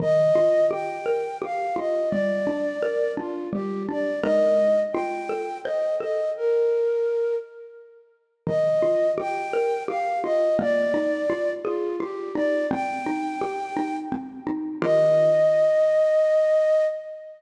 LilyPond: <<
  \new Staff \with { instrumentName = "Flute" } { \time 3/4 \key ees \major \tempo 4 = 85 ees''4 g''4 f''8 ees''8 | d''4. f'8 g'8 d''8 | ees''4 g''4 ees''8 ees''8 | bes'4. r4. |
ees''4 g''4 f''8 ees''8 | d''4. f'8 g'8 d''8 | g''2 r4 | ees''2. | }
  \new Staff \with { instrumentName = "Xylophone" } { \time 3/4 \key ees \major ees8 f'8 g'8 bes'8 g'8 f'8 | g8 d'8 bes'8 d'8 g8 d'8 | <aes ees' bes'>4 f'8 a'8 c''8 a'8 | r2. |
ees8 f'8 g'8 bes'8 g'8 f'8 | bes8 ees'8 f'8 aes'8 f'8 ees'8 | c'8 ees'8 g'8 ees'8 c'8 ees'8 | <ees f' g' bes'>2. | }
>>